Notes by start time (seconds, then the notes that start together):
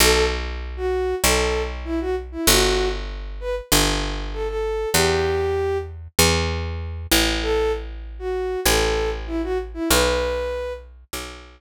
0.00 B1 A4
0.77 F#4
1.24 B1 A4
1.85 E4
2.01 F#4
2.32 E4
2.47 G1 F#4
3.40 B4
3.72 G1
4.33 A4
4.48 A4
4.93 E2 G4
6.19 E2
7.11 A1
7.42 A4
8.19 F#4
8.65 A1 A4
9.27 E4
9.43 F#4
9.74 E4
9.89 B1 B4
11.13 B1